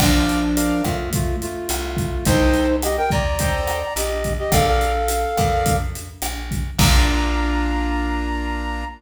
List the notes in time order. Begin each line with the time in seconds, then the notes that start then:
0.00 A#1 F3 D4 A#4 D5 F5, kick, cross-stick, crash
0.29 closed hi-hat
0.57 A#4 D5 F5, closed hi-hat
0.84 F2 A3 F4, kick, cross-stick, closed hi-hat
1.13 A3 F4, kick, closed hi-hat
1.42 A3 F4, closed hi-hat
1.69 C2, cross-stick, closed hi-hat
1.97 kick, closed hi-hat
2.25 C2 D#4 A4 C5 D#5 G5, kick, closed hi-hat
2.54 closed hi-hat
2.82 G4 D#5, cross-stick, closed hi-hat
2.97 A#4 G5
3.10 D#2 D5 A#5, kick, closed hi-hat
3.39 A4 C5 D#5 G5, kick, closed hi-hat
3.67 cross-stick, closed hi-hat
3.96 A#1 G4 D#5, closed hi-hat
4.24 kick, closed hi-hat
4.39 G4 D#5
4.52 A#1 A4 A#4 D5 F5, kick, cross-stick, closed hi-hat
4.67 A4 F5
4.81 closed hi-hat
5.08 closed hi-hat
5.37 F2 A#4 D5 F5, kick, cross-stick, closed hi-hat
5.66 kick, closed hi-hat
5.95 closed hi-hat
6.22 A#1, cross-stick, closed hi-hat
6.51 kick, closed hi-hat
6.78 A#1 A#3 D4 F4 A#5, kick, crash